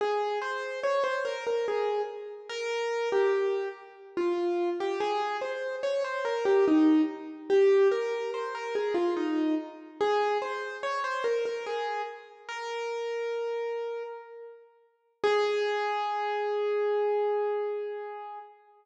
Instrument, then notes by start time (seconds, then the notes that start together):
acoustic grand piano
0.01 G#4
0.42 C5
0.84 C#5
1.04 C5
1.25 A#4
1.47 A#4
1.68 G#4
2.49 A#4
3.12 G4
4.17 F4
4.80 G4
5.00 G#4
5.41 C5
5.83 C#5
6.04 C5
6.25 A#4
6.45 G4
6.68 D#4
7.50 G4
7.91 A#4
8.34 C5
8.55 A#4
8.75 G#4
8.94 F4
9.17 D#4
10.01 G#4
10.42 C5
10.83 C#5
11.04 C5
11.24 A#4
11.45 A#4
11.66 G#4
12.49 A#4
15.24 G#4